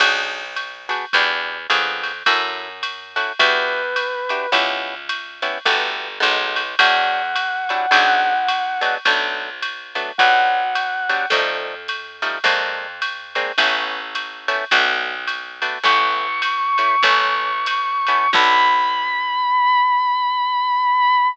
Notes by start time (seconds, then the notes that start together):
0.00 B1 B3 D4 F#4 G#4, kick, crash, ride
0.56 hi-hat pedal, ride
0.89 B3 D4 F#4 G#4, ride
1.13 E2 D4 E4 F#4 G4, kick, ride
1.70 F2 B3 D4 F4 G#4, hi-hat pedal, ride
2.03 ride
2.26 F#2 C#4 E4 F#4 A4, kick, ride
2.83 hi-hat pedal, ride
3.16 C#4 E4 F#4 A4, ride
3.39 E2 D4 E4 F#4 G4 B4, kick, ride
3.96 hi-hat pedal, ride
4.29 D4 E4 F#4 G4, ride
4.52 C#2 B3 C#4 E4 G4, kick, ride
5.09 hi-hat pedal, ride
5.42 B3 C#4 E4 G4, ride
5.65 G1 A3 B3 F#4 G4, kick, ride
6.20 B1 G#3 A3 B3 D#4, hi-hat pedal, ride
6.56 ride
6.79 E2 F#3 G3 D4 E4 F#5, kick, ride
7.36 hi-hat pedal, ride
7.69 F#3 G3 D4 E4, ride
7.91 B1 F#3 G#3 B3 D4, kick, ride
8.48 hi-hat pedal, ride
8.81 F#3 G#3 B3 D4, ride
9.05 B1 F#3 A3 B3 D4, kick, ride
9.62 hi-hat pedal, ride
9.95 F#3 A3 B3 D4, ride
10.18 B1 F#3 G3 B3 D4 F#5, kick, ride
10.75 hi-hat pedal, ride
11.09 F#3 G3 B3 D4, ride
11.30 F2 F3 G3 A3 D#4, kick, ride
11.88 hi-hat pedal, ride
12.22 F3 G3 A3 D#4, ride
12.44 F2 G#3 A#3 C4 D4, kick, ride
13.02 hi-hat pedal, ride
13.35 G#3 A#3 C4 D4, ride
13.58 A1 A3 B3 C#4 E4, kick, ride
14.15 hi-hat pedal, ride
14.48 A3 B3 C#4 E4, ride
14.71 B1 A3 B3 D4 F#4, kick, ride
15.27 hi-hat pedal, ride
15.62 A3 B3 D4 F#4, ride
15.83 A1 A3 B3 C#4 E4 C#6, kick, ride
16.42 hi-hat pedal, ride
16.78 A3 B3 C#4 E4, ride
17.03 A1 A3 B3 C#4 E4, kick, ride
17.66 hi-hat pedal, ride
18.07 A3 B3 C#4 E4, ride
18.33 B1 B3 D4 F#4 A4 B5, kick, crash